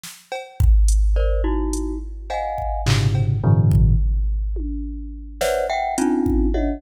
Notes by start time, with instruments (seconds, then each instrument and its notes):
0.04 snare
0.32 cowbell
0.60 kick
0.88 closed hi-hat
1.16 glockenspiel A#4 C5 D5
1.44 glockenspiel D#4 E4 F#4
1.73 closed hi-hat
2.30 glockenspiel D#5 F5 F#5 G#5, cowbell
2.58 kick
2.86 glockenspiel G#2 A#2 B2 C3 C#3 D3, clap
3.15 cowbell
3.44 glockenspiel G2 A2 B2 C#3 D#3 F3
3.71 kick
4.56 high tom
5.41 glockenspiel B4 C5 C#5 D5 E5 F#5, snare
5.70 glockenspiel E5 F#5 G5
5.98 glockenspiel C4 C#4 D4 D#4 F4, closed hi-hat
6.26 kick
6.54 glockenspiel C#5 D#5 E5 F#5, high tom